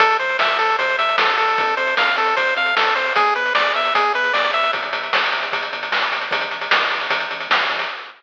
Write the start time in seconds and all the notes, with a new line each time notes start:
0.00 A1 A4, kick, closed hi-hat
0.11 closed hi-hat
0.19 A1 C5, closed hi-hat
0.29 closed hi-hat
0.39 A1 E5, snare
0.49 closed hi-hat
0.59 A1 A4, closed hi-hat
0.69 closed hi-hat
0.79 A1 C5, kick, closed hi-hat
0.89 closed hi-hat
0.98 A1 E5, closed hi-hat
1.09 closed hi-hat
1.18 A1 A4, snare
1.28 closed hi-hat
1.38 A1 A4, closed hi-hat
1.48 closed hi-hat
1.58 F2, kick, closed hi-hat
1.68 closed hi-hat
1.77 F2 C5, closed hi-hat
1.87 closed hi-hat
1.97 F2 F5, snare
2.07 closed hi-hat
2.16 F2 A4, closed hi-hat
2.27 closed hi-hat
2.37 F2 C5, kick, closed hi-hat
2.47 closed hi-hat
2.56 F2 F5, closed hi-hat
2.66 closed hi-hat
2.76 F2 A4, snare
2.86 closed hi-hat
2.95 F2 C5, closed hi-hat
3.06 closed hi-hat
3.16 E2 G#4, kick, closed hi-hat
3.26 closed hi-hat
3.35 E2 B4, closed hi-hat
3.46 closed hi-hat
3.55 E2 D5, snare
3.66 closed hi-hat
3.74 E2 E5, closed hi-hat
3.85 closed hi-hat
3.94 E2 G#4, kick, closed hi-hat
4.04 closed hi-hat
4.14 E2 B4, closed hi-hat
4.24 closed hi-hat
4.33 E2 D5, snare
4.44 closed hi-hat
4.53 E2 E5, closed hi-hat
4.63 closed hi-hat
4.73 G1, kick, closed hi-hat
4.83 closed hi-hat
4.93 G1, closed hi-hat
5.03 closed hi-hat
5.13 G1, snare
5.24 closed hi-hat
5.32 G1, closed hi-hat
5.43 closed hi-hat
5.52 G1, kick, closed hi-hat
5.63 closed hi-hat
5.73 G1, closed hi-hat
5.83 closed hi-hat
5.92 G1, snare
6.02 closed hi-hat
6.11 G1, closed hi-hat
6.21 closed hi-hat
6.31 A1, kick, closed hi-hat
6.41 closed hi-hat
6.51 A1, closed hi-hat
6.61 closed hi-hat
6.71 A1, snare
6.81 closed hi-hat
6.90 A1, closed hi-hat
7.01 closed hi-hat
7.10 A1, kick, closed hi-hat
7.20 closed hi-hat
7.31 A1, closed hi-hat
7.40 closed hi-hat
7.50 A1, snare
7.60 closed hi-hat
7.69 A1, closed hi-hat
7.79 closed hi-hat